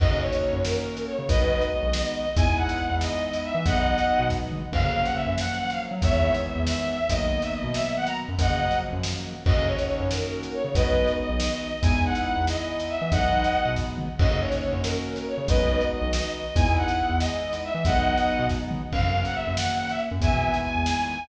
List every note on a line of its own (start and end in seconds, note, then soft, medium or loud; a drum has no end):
0.00 0.09 F#2 medium
0.00 1.16 A#3 medium
0.00 1.16 C#4 loud
0.00 1.16 D#4 medium
0.00 1.16 F#4 loud
0.00 0.19 D#5 loud
0.00 kick loud
0.00 crash medium
0.10 0.30 C#3 medium
0.21 0.60 C#5 loud
0.32 closed hi-hat medium
0.53 0.72 F#2 medium
0.64 1.06 A#4 loud
0.64 snare medium
0.97 closed hi-hat medium
1.07 1.27 C#5 loud
1.19 1.28 C#3 medium
1.29 1.39 B1 medium
1.29 2.26 G#3 medium
1.29 2.26 B3 loud
1.29 2.26 D#4 loud
1.29 2.26 F#4 loud
1.29 1.66 B4 loud
1.29 1.66 D#5 loud
1.29 kick loud
1.29 closed hi-hat medium
1.40 1.59 B1 medium
1.61 closed hi-hat soft
1.72 1.93 D#5 loud
1.83 2.02 B1 medium
1.93 2.12 D#5 loud
1.93 snare loud
2.15 2.35 D#5 loud
2.36 2.46 E2 medium
2.36 3.53 G#3 loud
2.36 3.53 B3 medium
2.36 3.53 D#4 loud
2.36 3.53 E4 loud
2.36 2.56 G#5 loud
2.36 kick loud
2.36 closed hi-hat medium
2.47 2.67 E2 medium
2.57 2.97 F#5 loud
2.69 closed hi-hat medium
2.90 3.09 E2 medium
3.01 3.41 D#5 loud
3.01 snare medium
3.33 closed hi-hat medium
3.44 3.64 E5 loud
3.55 3.64 E3 medium
3.66 3.75 B1 medium
3.66 4.62 F#3 loud
3.66 4.62 G#3 loud
3.66 4.62 B3 loud
3.66 4.62 D#4 loud
3.66 4.25 D#5 loud
3.66 4.25 F#5 loud
3.66 kick loud
3.66 closed hi-hat medium
3.76 3.96 B1 medium
3.98 closed hi-hat medium
4.20 4.39 B2 medium
4.30 kick medium
4.30 snare medium
4.52 mid tom medium
4.72 4.82 F#2 medium
4.72 5.89 F3 loud
4.72 5.89 F#3 loud
4.72 5.89 A#3 medium
4.72 5.89 C#4 medium
4.72 5.03 F5 loud
4.72 kick medium
4.72 crash medium
4.84 5.03 C#3 medium
5.04 5.15 F#5 loud
5.04 closed hi-hat medium
5.15 5.33 E5 medium
5.26 5.46 F#2 medium
5.38 5.57 F#5 loud
5.38 snare medium
5.59 5.69 F#5 loud
5.70 5.81 F5 medium
5.70 closed hi-hat medium
5.91 6.01 F#3 medium
6.02 6.12 E2 medium
6.02 6.99 D#3 loud
6.02 6.99 E3 loud
6.02 6.99 G#3 loud
6.02 6.99 B3 loud
6.02 6.39 C#5 loud
6.02 6.39 E5 loud
6.02 kick medium
6.02 closed hi-hat medium
6.12 6.31 E2 medium
6.34 closed hi-hat medium
6.45 6.62 E5 medium
6.56 6.75 E2 medium
6.67 6.88 E5 loud
6.67 snare loud
6.89 7.08 E5 loud
7.09 7.20 B1 medium
7.09 8.26 D#3 loud
7.09 8.26 F#3 loud
7.09 8.26 A#3 medium
7.09 8.26 B3 medium
7.09 7.40 D#5 loud
7.09 kick medium
7.09 closed hi-hat loud
7.21 7.40 B1 medium
7.42 7.53 E5 loud
7.42 closed hi-hat medium
7.53 7.74 D#5 loud
7.64 7.83 B2 medium
7.74 7.93 E5 loud
7.74 snare medium
7.96 8.07 F#5 loud
8.07 8.17 A#5 medium
8.07 closed hi-hat medium
8.28 8.38 F#2 medium
8.39 8.49 F#2 medium
8.39 9.35 C#3 medium
8.39 9.35 F3 loud
8.39 9.35 F#3 loud
8.39 9.35 A#3 loud
8.39 8.77 D#5 loud
8.39 8.77 F#5 loud
8.39 kick medium
8.39 closed hi-hat loud
8.50 8.69 C#3 medium
8.71 closed hi-hat medium
8.93 9.12 F#2 medium
9.03 snare loud
9.46 9.55 F#2 medium
9.46 10.63 A#3 medium
9.46 10.63 C#4 loud
9.46 10.63 D#4 medium
9.46 10.63 F#4 loud
9.46 9.67 D#5 loud
9.46 kick loud
9.46 crash medium
9.57 9.76 C#3 medium
9.67 10.05 C#5 loud
9.78 closed hi-hat medium
10.00 10.19 F#2 medium
10.11 10.52 A#4 loud
10.11 snare medium
10.43 closed hi-hat medium
10.54 10.74 C#5 loud
10.64 10.74 C#3 medium
10.75 10.84 B1 medium
10.75 11.72 G#3 medium
10.75 11.72 B3 loud
10.75 11.72 D#4 loud
10.75 11.72 F#4 loud
10.75 11.12 B4 loud
10.75 11.12 D#5 loud
10.75 kick loud
10.75 closed hi-hat medium
10.86 11.05 B1 medium
11.08 closed hi-hat soft
11.19 11.39 D#5 loud
11.29 11.49 B1 medium
11.40 11.57 D#5 loud
11.40 snare loud
11.60 11.80 D#5 loud
11.83 11.93 E2 medium
11.83 12.99 G#3 loud
11.83 12.99 B3 medium
11.83 12.99 D#4 loud
11.83 12.99 E4 loud
11.83 12.01 G#5 loud
11.83 kick loud
11.83 closed hi-hat medium
11.93 12.12 E2 medium
12.05 12.44 F#5 loud
12.15 closed hi-hat medium
12.36 12.56 E2 medium
12.47 12.86 D#5 loud
12.47 snare medium
12.80 closed hi-hat medium
12.89 13.10 E5 loud
13.01 13.11 E3 medium
13.12 13.21 B1 medium
13.12 14.09 F#3 loud
13.12 14.09 G#3 loud
13.12 14.09 B3 loud
13.12 14.09 D#4 loud
13.12 13.71 D#5 loud
13.12 13.71 F#5 loud
13.12 kick loud
13.12 closed hi-hat medium
13.23 13.42 B1 medium
13.44 closed hi-hat medium
13.66 13.85 B2 medium
13.76 kick medium
13.76 snare medium
13.98 mid tom medium
14.19 14.29 F#2 medium
14.19 15.35 A#3 medium
14.19 15.35 C#4 loud
14.19 15.35 D#4 medium
14.19 15.35 F#4 loud
14.19 14.41 D#5 loud
14.19 kick loud
14.19 crash medium
14.31 14.50 C#3 medium
14.40 14.78 C#5 loud
14.52 closed hi-hat medium
14.73 14.92 F#2 medium
14.83 15.25 A#4 loud
14.83 snare medium
15.16 closed hi-hat medium
15.28 15.48 C#5 loud
15.38 15.47 C#3 medium
15.48 15.58 B1 medium
15.48 16.45 G#3 medium
15.48 16.45 B3 loud
15.48 16.45 D#4 loud
15.48 16.45 F#4 loud
15.48 15.85 B4 loud
15.48 15.85 D#5 loud
15.48 kick loud
15.48 closed hi-hat medium
15.60 15.79 B1 medium
15.81 closed hi-hat soft
15.93 16.13 D#5 loud
16.02 16.21 B1 medium
16.13 16.31 D#5 loud
16.13 snare loud
16.34 16.54 D#5 loud
16.55 16.65 E2 medium
16.55 17.72 G#3 loud
16.55 17.72 B3 medium
16.55 17.72 D#4 loud
16.55 17.72 E4 loud
16.55 16.74 G#5 loud
16.55 kick loud
16.55 closed hi-hat medium
16.66 16.86 E2 medium
16.77 17.16 F#5 loud
16.88 closed hi-hat medium
17.09 17.29 E2 medium
17.19 17.58 D#5 loud
17.19 snare medium
17.53 closed hi-hat medium
17.64 17.85 E5 loud
17.75 17.84 E3 medium
17.85 17.95 B1 medium
17.85 18.82 F#3 loud
17.85 18.82 G#3 loud
17.85 18.82 B3 loud
17.85 18.82 D#4 loud
17.85 18.45 D#5 loud
17.85 18.45 F#5 loud
17.85 kick loud
17.85 closed hi-hat medium
17.96 18.15 B1 medium
18.17 closed hi-hat medium
18.39 18.59 B2 medium
18.49 kick medium
18.49 snare medium
18.71 mid tom medium
18.92 19.02 F#2 medium
18.92 20.09 C#3 loud
18.92 20.09 F#3 medium
18.92 20.09 A#3 loud
18.92 19.21 F5 loud
18.92 kick medium
18.92 crash medium
19.03 19.23 F#2 medium
19.25 19.35 F#5 loud
19.25 closed hi-hat medium
19.35 19.53 E5 loud
19.46 19.66 F#2 medium
19.57 19.77 F#5 loud
19.57 snare loud
19.78 19.89 F#5 loud
19.89 20.00 E5 loud
19.89 closed hi-hat medium
20.11 20.21 F#2 medium
20.21 20.30 E2 medium
20.21 21.18 D#3 loud
20.21 21.18 E3 loud
20.21 21.18 G#3 medium
20.21 21.18 B3 loud
20.21 20.58 E5 loud
20.21 20.58 G#5 loud
20.21 kick loud
20.21 closed hi-hat medium
20.32 20.52 B2 medium
20.54 closed hi-hat medium
20.63 20.83 G#5 loud
20.75 20.94 E2 medium
20.86 21.07 G#5 loud
20.86 snare medium
21.07 21.24 G#5 loud